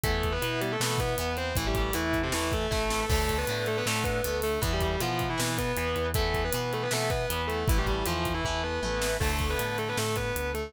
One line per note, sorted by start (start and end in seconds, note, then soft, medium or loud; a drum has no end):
0.04 0.38 E2 loud
0.04 0.38 E3 loud
0.04 0.31 A3 medium
0.04 0.38 B3 medium
0.04 0.31 A4 loud
0.04 kick medium
0.04 closed hi-hat medium
0.23 kick medium
0.23 closed hi-hat medium
0.32 0.59 B3 medium
0.32 0.59 B4 medium
0.42 0.76 B2 medium
0.42 0.76 E3 medium
0.42 0.76 B3 medium
0.42 closed hi-hat medium
0.61 0.70 G3 medium
0.61 0.70 G4 medium
0.61 closed hi-hat medium
0.71 0.81 A3 medium
0.71 0.81 A4 medium
0.80 1.14 B2 medium
0.80 1.15 E3 medium
0.80 0.99 A3 medium
0.80 1.15 B3 medium
0.80 0.99 A4 medium
0.80 snare medium
0.98 1.33 B3 medium
0.98 1.33 B4 medium
0.98 kick medium
0.98 closed hi-hat medium
1.18 1.53 E2 medium
1.18 1.53 E3 medium
1.18 1.53 B3 medium
1.18 closed hi-hat medium
1.37 1.53 C4 medium
1.37 1.53 C5 medium
1.37 closed hi-hat medium
1.55 1.91 A1 loud
1.55 1.91 E3 medium
1.55 1.66 E3 medium
1.55 1.91 A3 medium
1.55 1.66 E4 loud
1.55 kick medium
1.55 closed hi-hat medium
1.66 1.75 G3 medium
1.66 1.75 G4 medium
1.75 1.94 G3 medium
1.75 1.94 G4 medium
1.75 kick medium
1.75 closed hi-hat medium
1.93 2.29 E2 medium
1.93 2.18 E3 medium
1.93 2.28 E3 medium
1.93 2.28 A3 medium
1.93 2.18 E4 medium
1.93 closed hi-hat medium
2.13 kick medium
2.13 closed hi-hat medium
2.23 2.32 C3 medium
2.23 2.32 C4 medium
2.32 2.67 E2 medium
2.32 2.67 E3 medium
2.32 2.49 E3 medium
2.32 2.67 A3 medium
2.32 2.49 E4 medium
2.32 snare medium
2.52 3.07 A3 medium
2.52 3.07 A4 medium
2.52 kick medium
2.52 closed hi-hat soft
2.71 3.06 A1 medium
2.71 3.05 E3 medium
2.71 3.05 A3 loud
2.71 kick medium
2.71 snare medium
2.90 snare medium
3.09 3.44 D2 loud
3.09 3.45 D3 medium
3.09 3.33 A3 medium
3.09 3.45 A3 medium
3.09 3.33 A4 loud
3.09 kick medium
3.09 crash medium
3.29 kick medium
3.29 closed hi-hat medium
3.38 3.65 B3 medium
3.38 3.65 B4 medium
3.47 3.82 A2 medium
3.47 3.83 D3 medium
3.47 3.83 A3 medium
3.47 closed hi-hat medium
3.66 3.76 A3 medium
3.66 3.76 A4 medium
3.66 closed hi-hat medium
3.77 3.86 B3 medium
3.77 3.86 B4 medium
3.86 4.20 A2 medium
3.86 4.21 D3 medium
3.86 4.03 A3 medium
3.86 4.21 A3 medium
3.86 4.03 A4 medium
3.86 snare medium
4.04 4.35 B3 medium
4.04 4.35 B4 medium
4.04 kick medium
4.04 closed hi-hat medium
4.24 4.58 D2 medium
4.24 4.59 D3 medium
4.24 4.59 A3 medium
4.24 closed hi-hat medium
4.42 4.59 A3 medium
4.42 4.59 A4 medium
4.42 open hi-hat medium
4.62 4.97 E2 loud
4.62 4.71 E3 medium
4.62 4.96 E3 loud
4.62 4.96 B3 medium
4.62 4.71 E4 loud
4.62 kick medium
4.62 closed hi-hat medium
4.73 4.81 G3 medium
4.73 4.81 G4 medium
4.81 4.99 G3 medium
4.81 4.99 G4 medium
4.81 kick medium
4.81 closed hi-hat medium
5.00 5.35 B2 medium
5.00 5.35 E3 medium
5.00 5.26 F3 medium
5.00 5.35 B3 medium
5.00 5.26 F4 medium
5.00 closed hi-hat medium
5.19 kick medium
5.19 closed hi-hat medium
5.29 5.38 E3 medium
5.29 5.38 E4 medium
5.38 5.73 B2 medium
5.38 5.72 E3 medium
5.38 5.55 E3 medium
5.38 5.72 B3 medium
5.38 5.55 E4 medium
5.38 snare medium
5.58 6.05 B3 medium
5.58 6.05 B4 medium
5.58 kick medium
5.58 closed hi-hat medium
5.77 5.95 E2 medium
5.77 6.11 E3 medium
5.77 6.11 B3 medium
5.77 closed hi-hat medium
5.96 6.50 E2 medium
5.96 closed hi-hat medium
6.14 6.50 E3 medium
6.14 6.41 A3 loud
6.14 6.50 B3 medium
6.14 6.41 A4 loud
6.14 kick medium
6.14 closed hi-hat medium
6.34 kick medium
6.34 closed hi-hat medium
6.44 6.69 B3 medium
6.44 6.69 B4 medium
6.53 6.88 B2 medium
6.53 6.89 E3 medium
6.53 6.89 B3 medium
6.53 closed hi-hat loud
6.73 6.82 A3 medium
6.73 6.82 A4 medium
6.73 closed hi-hat soft
6.82 6.91 B3 medium
6.82 6.91 B4 medium
6.91 7.26 B2 medium
6.91 7.26 E3 medium
6.91 7.09 A3 medium
6.91 7.26 B3 medium
6.91 7.09 A4 medium
6.91 snare medium
7.10 7.42 B3 medium
7.10 7.42 B4 medium
7.10 kick medium
7.10 closed hi-hat medium
7.30 7.64 E2 medium
7.30 7.64 E3 medium
7.30 7.64 B3 medium
7.30 closed hi-hat medium
7.48 7.66 A3 medium
7.48 7.66 A4 medium
7.48 closed hi-hat medium
7.68 8.02 A1 loud
7.68 7.77 E3 medium
7.68 8.03 E3 loud
7.68 8.03 A3 loud
7.68 7.77 E4 loud
7.68 kick loud
7.68 closed hi-hat medium
7.77 7.86 G3 medium
7.77 7.86 G4 medium
7.86 8.04 G3 medium
7.86 8.04 G4 medium
7.86 kick medium
7.86 closed hi-hat soft
8.06 8.41 E2 medium
8.06 8.41 E3 medium
8.06 8.32 F3 medium
8.06 8.41 A3 medium
8.06 8.32 F4 medium
8.06 closed hi-hat medium
8.25 kick medium
8.25 closed hi-hat medium
8.34 8.43 E3 medium
8.34 8.43 E4 medium
8.44 8.79 E2 medium
8.44 8.61 E3 medium
8.44 8.80 E3 medium
8.44 8.80 A3 medium
8.44 8.61 E4 medium
8.44 kick medium
8.44 floor tom medium
8.63 9.12 B3 medium
8.63 9.12 B4 medium
8.83 9.17 A1 medium
8.83 9.17 E3 medium
8.83 9.17 A3 medium
8.83 high tom medium
9.02 snare medium
9.20 9.55 D2 loud
9.20 10.58 D3 loud
9.20 9.47 A3 medium
9.20 10.58 A3 loud
9.20 9.47 A4 loud
9.20 kick medium
9.20 crash medium
9.39 kick medium
9.39 closed hi-hat medium
9.50 9.75 B3 medium
9.50 9.75 B4 medium
9.59 9.93 A2 medium
9.59 closed hi-hat medium
9.78 9.87 A3 medium
9.78 9.87 A4 medium
9.78 closed hi-hat medium
9.88 9.97 B3 medium
9.88 9.97 B4 medium
9.97 10.32 A2 medium
9.97 10.16 A3 medium
9.97 10.16 A4 medium
9.97 snare medium
10.16 10.49 B3 medium
10.16 10.49 B4 medium
10.16 kick medium
10.16 closed hi-hat medium
10.36 10.70 D2 medium
10.36 closed hi-hat medium
10.54 10.71 A3 medium
10.54 10.71 A4 medium
10.54 closed hi-hat medium